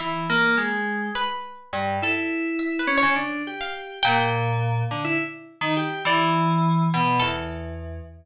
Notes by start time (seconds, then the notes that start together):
0.00 E3 E5
0.30 A#3
0.57 G#3
1.15 B4
1.73 G2
2.02 E4 A4
2.59 E5
2.79 B4
2.87 C#4
2.98 C#5
3.03 C#3
3.16 D4
3.47 G4
3.61 F5
4.03 A#2 G5
4.91 D3
5.05 E4
5.61 D#3
5.77 G4
6.05 E3 D5
6.94 B2
7.20 E2 A4